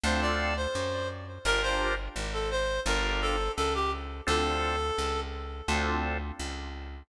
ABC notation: X:1
M:4/4
L:1/16
Q:1/4=85
K:Dm
V:1 name="Clarinet"
c d2 c3 z2 | B c2 z2 A c2 B2 A2 A G z2 | A6 z10 |]
V:2 name="Drawbar Organ"
[CDFA]8 | [DFGB]8 [DFGB]8 | [CDFA]8 [CDFA]8 |]
V:3 name="Electric Bass (finger)" clef=bass
D,,4 _G,,4 | G,,,4 _A,,,4 G,,,4 ^C,,4 | D,,4 ^C,,4 D,,4 C,,4 |]